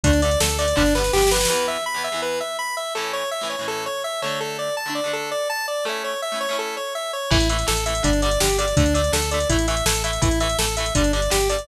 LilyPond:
<<
  \new Staff \with { instrumentName = "Lead 1 (square)" } { \time 4/4 \key a \mixolydian \tempo 4 = 165 d'8 d''8 a'8 d''8 d'8 b'8 g'8 b'8 | \key e \mixolydian b'8 e''8 b''8 e''8 b'8 e''8 b''8 e''8 | a'8 cis''8 e''8 cis''8 a'8 cis''8 e''8 cis''8 | a'8 d''8 a''8 d''8 a'8 d''8 a''8 d''8 |
a'8 cis''8 e''8 cis''8 a'8 cis''8 e''8 cis''8 | \key a \mixolydian e'8 e''8 a'8 e''8 d'8 d''8 g'8 d''8 | d'8 d''8 a'8 d''8 e'8 e''8 a'8 e''8 | e'8 e''8 a'8 e''8 d'8 d''8 g'8 d''8 | }
  \new Staff \with { instrumentName = "Overdriven Guitar" } { \time 4/4 \key a \mixolydian <d a>8 <d a>8 <d a>8 <d a>8 <d g b>8 <d g b>8 <d g b>8 <d g b>8 | \key e \mixolydian <e, e b>4~ <e, e b>16 <e, e b>8 <e, e b>2~ <e, e b>16 | <a, e cis'>4~ <a, e cis'>16 <a, e cis'>8 <a, e cis'>4.~ <a, e cis'>16 <d a d'>8~ | <d a d'>4~ <d a d'>16 <d a d'>8 <d a d'>2~ <d a d'>16 |
<a cis' e'>4~ <a cis' e'>16 <a cis' e'>8 <a cis' e'>2~ <a cis' e'>16 | \key a \mixolydian <e a>8 <e a>8 <e a>8 <e a>8 <d g>8 <d g>8 <d g>8 <d g>8 | <d a>8 <d a>8 <d a>8 <d a>8 <e a>8 <e a>8 <e a>8 <e a>8 | <e a>8 <e a>8 <e a>8 <e a>8 <d g>8 <d g>8 <d g>8 <d g>8 | }
  \new Staff \with { instrumentName = "Synth Bass 1" } { \clef bass \time 4/4 \key a \mixolydian d,4 d,4 g,,4 g,,4 | \key e \mixolydian r1 | r1 | r1 |
r1 | \key a \mixolydian a,,4 a,,4 g,,4 g,,4 | d,4 d,4 a,,4 a,,4 | a,,4 a,,4 g,,4 g,,4 | }
  \new DrumStaff \with { instrumentName = "Drums" } \drummode { \time 4/4 <hh bd>16 hh16 hh16 hh16 sn16 hh16 hh16 hh16 <bd sn>16 sn16 sn16 sn16 sn32 sn32 sn32 sn32 sn32 sn32 sn32 sn32 | r4 r4 r4 r4 | r4 r4 r4 r4 | r4 r4 r4 r4 |
r4 r4 r4 r4 | <cymc bd>16 hh16 hh16 hh16 sn16 hh16 hh16 hh16 <hh bd>16 hh16 hh16 hh16 sn16 hh16 hh16 hh16 | <hh bd>16 hh16 hh16 hh16 sn16 hh16 hh16 hh16 <hh bd>16 hh16 hh16 hh16 sn16 hh16 hh16 hh16 | <hh bd>16 hh16 hh16 hh16 sn16 hh16 hh16 hh16 <hh bd>16 hh16 hh16 hh16 sn16 hh16 hh16 hh16 | }
>>